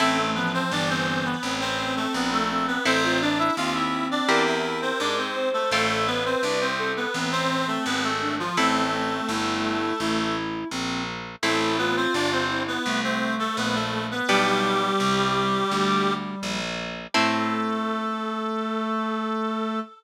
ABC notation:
X:1
M:4/4
L:1/16
Q:1/4=84
K:Am
V:1 name="Clarinet"
[A,A]2 [B,B] [Cc] [Dd] [Cc]2 [B,B]2 [Cc]2 [A,A] [B,B] [A,A]2 [B,B] | [Cc]2 [Dd] [Ee] [Ff] [Ee]2 [Dd]2 [Ee]2 [Cc] [Dd] [Cc]2 [A,A] | [A,A]2 [B,B] [Cc] [Dd] [Cc]2 [B,B]2 [Cc]2 [A,A] [B,B] [A,A]2 [F,F] | [A,A]12 z4 |
[A,A]2 [B,B] [Cc] [Dd] [Cc]2 [B,B]2 [Cc]2 [A,A] [B,B] [A,A]2 [B,B] | [G,G]12 z4 | A16 |]
V:2 name="Clarinet"
C A, F,2 E,4 C6 C2 | A F D2 C4 _B6 c2 | A2 B4 A2 C6 D z | C2 C2 E4 E4 C2 z2 |
E2 F4 E2 A,6 A, z | G,14 z2 | A,16 |]
V:3 name="Acoustic Guitar (steel)"
[CEA]16 | [CEA]8 [CEG_B]8 | [CFA]16 | [CEA]16 |
[CEA]16 | [B,DG]16 | [CEA]16 |]
V:4 name="Harpsichord" clef=bass
A,,,4 G,,,4 A,,,4 _B,,,4 | A,,,4 _E,,4 =E,,4 ^G,,4 | A,,,4 C,,4 A,,,4 ^G,,,4 | A,,,4 G,,,4 A,,,4 _B,,,4 |
A,,,4 G,,,4 C,,4 _B,,,4 | B,,,4 C,,4 D,,4 _B,,,4 | A,,16 |]